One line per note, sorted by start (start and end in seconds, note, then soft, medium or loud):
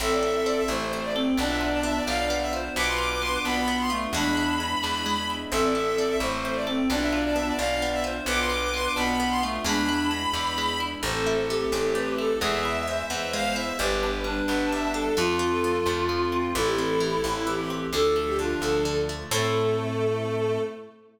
0.00 0.62 A1 medium
0.00 1.37 C4 medium
0.00 0.46 C4 medium
0.00 1.37 E4 medium
0.00 0.64 A4 loud
0.00 1.37 A4 medium
0.00 0.11 E5 loud
0.11 0.22 D5 medium
0.23 1.15 A4 medium
0.23 0.34 E5 medium
0.36 0.46 E5 medium
0.46 0.92 C4 medium
0.46 0.57 D5 medium
0.57 0.68 E5 medium
0.68 1.31 A1 medium
0.68 1.12 A3 loud
0.68 1.34 E4 medium
0.68 1.02 C5 medium
0.93 1.37 C4 medium
1.03 1.14 D5 medium
1.15 1.35 C4 loud
1.15 1.38 A4 medium
1.37 2.00 B1 medium
1.37 1.83 B3 medium
1.37 2.75 B3 medium
1.37 1.99 D4 loud
1.37 2.75 D4 loud
1.37 2.75 F4 medium
1.37 1.49 D5 loud
1.48 1.59 E5 medium
1.61 2.52 F4 medium
1.61 1.72 D5 medium
1.73 1.83 D5 medium
1.83 2.30 B3 medium
1.83 1.96 E5 medium
1.95 2.06 D5 medium
2.07 2.69 B1 medium
2.07 2.73 D4 medium
2.07 2.47 D5 loud
2.07 2.36 F5 medium
2.30 2.74 B3 medium
2.41 2.52 E5 medium
2.53 2.75 F4 medium
2.53 2.73 C5 loud
2.76 3.38 B1 medium
2.76 4.13 B3 medium
2.76 3.21 B3 medium
2.76 4.13 D4 medium
2.76 4.13 F4 medium
2.76 3.40 B4 loud
2.76 2.87 D6 loud
2.87 2.98 C6 medium
2.98 3.89 F4 medium
2.98 3.10 D6 medium
3.11 3.22 D6 medium
3.22 3.67 B3 medium
3.22 3.33 C6 medium
3.33 3.43 D6 medium
3.44 4.07 B1 medium
3.44 3.88 B3 loud
3.44 4.11 D4 medium
3.44 3.77 B5 medium
3.68 4.11 B3 medium
3.80 3.91 C6 medium
3.90 4.11 A3 loud
3.90 4.12 F4 medium
4.13 4.75 E2 medium
4.13 5.50 G#3 medium
4.13 4.60 G#3 medium
4.13 5.50 B3 medium
4.13 5.50 D4 medium
4.13 4.56 D4 loud
4.13 5.50 E4 medium
4.13 5.28 B5 loud
4.37 5.29 E4 medium
4.60 5.05 G#3 medium
4.83 5.46 E2 medium
4.83 5.48 D4 medium
5.06 5.49 G#3 medium
5.30 5.52 E4 medium
5.51 6.14 A1 medium
5.51 5.75 C4 medium
5.51 6.88 C4 medium
5.51 6.88 E4 medium
5.51 6.15 A4 loud
5.51 6.88 A4 medium
5.51 5.62 E5 loud
5.63 5.74 D5 medium
5.75 5.98 A4 medium
5.75 5.85 E5 medium
5.86 5.97 E5 medium
5.97 6.21 C4 medium
5.97 6.08 D5 medium
6.09 6.20 E5 medium
6.20 6.82 A1 medium
6.20 6.64 A3 loud
6.20 6.43 E4 medium
6.20 6.55 C5 medium
6.45 6.68 C4 medium
6.55 6.66 D5 medium
6.67 6.88 C4 loud
6.67 6.89 A4 medium
6.89 7.52 B1 medium
6.89 7.13 B3 medium
6.89 8.26 B3 medium
6.89 7.50 D4 loud
6.89 8.26 D4 loud
6.89 8.26 F4 medium
6.89 7.01 D5 loud
7.01 7.12 E5 medium
7.12 7.35 F4 medium
7.12 7.23 D5 medium
7.25 7.35 D5 medium
7.35 7.59 B3 medium
7.35 7.46 E5 medium
7.47 7.58 D5 medium
7.59 8.21 B1 medium
7.59 7.82 D4 medium
7.59 8.00 D5 loud
7.59 7.87 F5 medium
7.82 8.05 B3 medium
7.93 8.04 E5 medium
8.04 8.26 F4 medium
8.04 8.23 C5 loud
8.26 8.88 B1 medium
8.26 9.64 B3 medium
8.26 8.51 B3 medium
8.26 9.64 D4 medium
8.26 9.64 F4 medium
8.26 8.92 B4 loud
8.26 8.39 D6 loud
8.39 8.50 C6 medium
8.50 8.73 F4 medium
8.50 8.61 D6 medium
8.62 8.73 D6 medium
8.74 8.97 B3 medium
8.74 8.85 C6 medium
8.85 8.96 D6 medium
8.96 9.59 B1 medium
8.96 9.40 B3 loud
8.96 9.19 D4 medium
8.96 9.29 B5 medium
9.20 9.43 B3 medium
9.30 9.41 C6 medium
9.42 9.62 A3 loud
9.42 9.65 F4 medium
9.64 10.27 E2 medium
9.64 11.02 G#3 medium
9.64 9.89 G#3 medium
9.64 11.02 B3 medium
9.64 11.02 D4 medium
9.64 10.08 D4 loud
9.64 11.02 E4 medium
9.64 10.79 B5 loud
9.89 10.12 E4 medium
10.11 10.34 G#3 medium
10.34 10.96 E2 medium
10.34 10.58 D4 medium
10.58 10.81 G#3 medium
10.80 11.02 E4 medium
11.03 11.65 A1 medium
11.03 11.50 A3 medium
11.03 12.40 A3 medium
11.03 12.40 C4 medium
11.03 12.40 E4 medium
11.03 11.65 A4 loud
11.03 11.35 C5 loud
11.27 12.18 E4 medium
11.49 11.94 A3 medium
11.49 12.24 G4 loud
11.72 12.34 A1 medium
11.72 12.38 C4 medium
11.72 11.92 A4 medium
11.95 12.39 A3 medium
11.95 12.15 B4 medium
12.18 12.40 E4 medium
12.18 12.37 A4 medium
12.41 13.03 E2 medium
12.41 13.78 G#3 medium
12.41 12.87 G#3 medium
12.41 13.78 B3 medium
12.41 13.78 E4 medium
12.41 12.69 G#4 loud
12.41 13.04 E5 medium
12.65 13.55 E4 medium
12.87 13.33 G#3 medium
12.87 13.69 C5 medium
13.10 13.72 E2 medium
13.10 13.75 B3 medium
13.10 13.30 E5 medium
13.33 13.77 G#3 medium
13.33 13.55 F5 loud
13.56 13.78 E4 medium
13.56 13.77 E5 medium
13.79 14.42 G1 medium
13.79 14.24 G3 medium
13.79 15.16 G3 medium
13.79 15.16 B3 medium
13.79 15.16 D4 medium
13.79 14.11 G4 loud
13.79 14.39 B4 medium
14.03 14.94 D4 medium
14.24 14.72 G3 medium
14.24 15.10 D4 loud
14.48 15.10 G1 medium
14.48 15.14 B3 medium
14.48 14.69 B4 medium
14.72 15.16 G3 medium
14.72 14.91 E5 medium
14.94 15.16 D4 medium
14.94 15.16 A4 medium
15.17 15.80 F2 medium
15.17 15.63 F3 medium
15.17 16.54 F3 medium
15.17 16.54 A3 medium
15.17 16.54 C4 medium
15.17 15.46 F4 loud
15.17 16.50 F4 loud
15.39 16.32 C4 medium
15.51 15.84 A4 medium
15.64 16.08 F3 medium
15.86 16.48 F2 medium
15.86 16.51 A3 medium
16.09 16.53 F3 medium
16.32 16.54 C4 medium
16.55 17.17 A1 medium
16.55 17.00 E3 medium
16.55 17.92 E3 loud
16.55 17.92 A3 loud
16.55 17.92 C4 medium
16.55 17.45 E4 loud
16.55 16.67 A4 loud
16.66 16.77 G4 medium
16.78 17.70 C4 medium
16.78 16.89 A4 medium
16.89 17.00 A4 medium
17.00 17.46 E3 medium
17.00 17.12 G4 medium
17.12 17.23 A4 medium
17.24 17.87 A1 medium
17.24 17.89 A3 medium
17.24 17.53 E4 medium
17.47 17.90 E3 medium
17.47 17.87 G4 medium
17.60 17.70 G4 medium
17.70 17.92 C4 medium
17.93 18.55 D2 medium
17.93 19.29 D3 loud
17.93 18.38 D3 medium
17.93 19.29 F3 medium
17.93 19.29 A3 loud
17.93 18.14 A4 loud
17.93 18.34 A4 loud
18.16 19.09 A3 medium
18.16 18.27 A4 medium
18.27 18.38 G4 medium
18.39 18.85 D3 medium
18.39 18.82 D4 loud
18.39 18.60 F4 medium
18.61 19.24 D2 medium
18.61 19.28 F3 medium
18.61 18.98 A4 medium
18.85 19.29 D3 medium
19.09 19.31 A3 medium
19.31 20.58 A2 loud
19.31 20.59 A3 loud
19.31 20.58 C4 medium
19.31 20.58 C4 loud
19.31 20.58 E4 medium
19.31 20.58 E4 loud
19.31 20.58 A4 loud
19.31 20.58 A4 medium